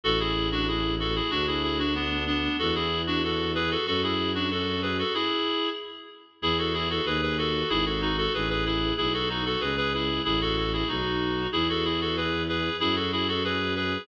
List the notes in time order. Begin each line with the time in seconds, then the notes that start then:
0.04 A1 F#4 A4
0.19 E4 G#4
0.51 D4 F#4
0.68 E4 G#4
0.99 F#4 A4
1.15 E4 G#4
1.31 D2 D4 F#4
1.47 E4 G#4
1.63 E4 G#4
1.79 D4 F#4
1.95 B3 D4
2.27 B3 D4
2.59 E2 F#4 A4
2.75 E4 G#4
3.07 D4 F#4
3.23 F#4 A4
3.55 G#4 B4
3.70 F#4 A4
3.86 F#2 F#4 A4
4.03 E4 G#4
4.35 D4 F#4
4.51 F#4 A4
4.82 G#4 B4
4.98 F#4 A4
5.14 E4 G#4
6.42 E2 E4 G#4
6.58 F#4 A4
6.73 E4 G#4
6.90 F#4 A4
7.05 D#2 G#4 B4
7.22 G#4 B4
7.38 F#4 A4
7.69 G#1 E4 G#4
7.86 F#4 A4
8.01 D#4 F#4
8.17 F#4 A4
8.34 A1 G#4 B4
8.49 G#4 B4
8.65 E4 G#4
8.97 B1 E4 G#4
9.13 F#4 A4
9.29 D#4 F#4
9.45 F#4 A4
9.60 C#2 G#4 B4
9.77 G#4 B4
9.93 E4 G#4
10.24 A1 E4 G#4
10.41 F#4 A4
10.56 F#4 A4
10.73 E4 G#4
10.88 B1 D#4 F#4
11.52 E2 E4 G#4
11.69 F#4 A4
11.84 E4 G#4
12.01 F#4 A4
12.17 G#4 B4
12.49 G#4 B4
12.80 F#2 E4 G#4
12.95 F#4 A4
13.12 E4 G#4
13.28 F#4 A4
13.44 G#4 B4
13.76 G#4 B4